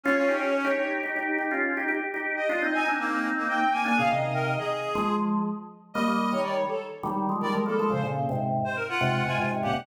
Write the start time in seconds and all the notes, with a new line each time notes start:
0.03 C#4 F4 C#5
0.17 C#4 F4
0.28 D#4 G4
0.65 D#4 G4
1.03 D#4 G4
1.16 D#4 G4
1.38 D#4 G4
1.51 C#4 F4
1.77 D#4 G4
1.88 D#4 G4
2.14 D#4 G4
2.36 D#5
2.49 D4 F4
2.62 C4 D#4
2.73 D#4 G#5
2.86 C4 D4 D#4
3.00 A#3
3.37 A#3
3.48 A#3 G5
3.71 A#3 G#5
3.85 A#3 D4 G#5
3.96 A#2 C#3 G#4 F5
4.10 C3 D#3 D#5
4.34 A#4
4.58 G#4
4.95 F3 G#3
5.94 G3 A#3 D#5
6.08 G3 A#3
6.32 D#3 G3 C#5
6.43 D5
6.68 A4
7.03 D#3 G3
7.29 F3 G#3
7.40 D#3 G3 A#4 D5
7.53 F3 G#3
7.66 G3 A#3 A4
7.78 F3 G#3 A4
7.90 A#2 C#3 C5
8.03 A#2 C#3
8.29 G#2 C3
8.65 C5
8.76 A#4
8.88 F4 F#5
9.00 G#2 C3 F#5
9.14 F#5
9.25 G#2 C3 F4 G#5
9.38 G#2 C3 F4
9.51 G#2 C3
9.62 A#2 C#3 G4 F#5
9.73 G#2 C3